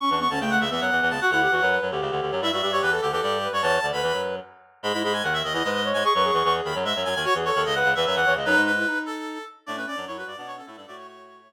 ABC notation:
X:1
M:3/4
L:1/16
Q:1/4=149
K:D
V:1 name="Clarinet"
c' c' c' a g f e e f3 a | f f5 z6 | e e e c B A G G G3 c | a3 b3 z6 |
[K:E] b b b g f e d d d3 g | c' c'2 c' c' z b z e2 g g | c z c2 d f2 e e f2 z | B2 B4 A4 z2 |
[K:D] d B d2 c B d d c A A A | d c c6 z4 |]
V:2 name="Clarinet"
C D B, C A,3 B,5 | F E G F B3 G5 | E F G G2 A2 A3 B c | c2 d B5 z4 |
[K:E] G E G z4 E B2 c2 | G B G6 z4 | F G A A2 B2 B3 c d | D3 E D6 z2 |
[K:D] D C C D E F2 D D C E D | F6 F4 z2 |]
V:3 name="Clarinet"
z [E,,E,]2 [D,,D,] [C,,C,]2 [C,,C,] [E,,E,] [F,,F,] [E,,E,] [E,,E,] [C,,C,] | z [D,,D,]2 [E,,E,] [F,,F,]2 [F,,F,] [D,,D,] [C,,C,] [D,,D,] [D,,D,] [F,,F,] | [G,,G,] [G,,G,] [G,,G,]2 [E,,E,]2 [D,,D,] [E,,E,] [G,,G,]3 [G,,G,] | [E,,E,]2 [D,,D,] [D,,D,] [E,,E,] [F,,F,]3 z4 |
[K:E] [G,,G,] [G,,G,] [G,,G,]2 [D,,D,]2 [D,,D,] [E,,E,] [G,,G,]3 [G,,G,] | z [F,,F,]2 [E,,E,] [E,,E,]2 [D,,D,] [F,,F,] [G,,G,] [F,,F,] [F,,F,] [D,,D,] | z [E,,E,]2 [D,,D,] [C,,C,]2 [C,,C,] [E,,E,] [F,,F,] [E,,E,] [E,,E,] [C,,C,] | [F,,F,] [G,,G,]3 z8 |
[K:D] [A,,A,]2 z [F,,F,] [F,,F,]2 [G,,G,] [B,,B,]3 [A,,A,] [G,,G,] | [A,,A,]8 z4 |]